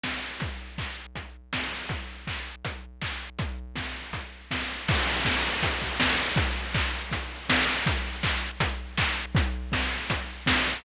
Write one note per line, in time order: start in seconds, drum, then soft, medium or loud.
0.03 kick medium
0.03 snare loud
0.40 kick medium
0.40 closed hi-hat medium
0.78 kick medium
0.78 clap medium
1.15 kick medium
1.15 closed hi-hat medium
1.53 kick medium
1.53 snare loud
1.89 kick medium
1.89 closed hi-hat medium
2.27 kick medium
2.27 clap medium
2.65 kick medium
2.65 closed hi-hat medium
3.01 kick medium
3.01 clap loud
3.39 kick loud
3.39 closed hi-hat medium
3.76 kick medium
3.76 snare medium
4.13 kick medium
4.13 closed hi-hat medium
4.51 kick medium
4.51 snare loud
4.88 kick loud
4.88 crash loud
5.25 kick loud
5.25 snare loud
5.63 kick loud
5.63 closed hi-hat loud
5.82 kick medium
6.00 kick medium
6.00 snare loud
6.36 kick loud
6.36 closed hi-hat loud
6.74 kick loud
6.74 clap loud
7.11 kick medium
7.11 closed hi-hat loud
7.49 kick medium
7.49 snare loud
7.86 kick loud
7.86 closed hi-hat loud
8.23 kick loud
8.23 clap loud
8.60 kick loud
8.60 closed hi-hat loud
8.98 kick loud
8.98 clap loud
9.35 kick loud
9.35 closed hi-hat loud
9.72 kick medium
9.72 snare loud
10.10 kick loud
10.10 closed hi-hat loud
10.46 kick loud
10.46 snare loud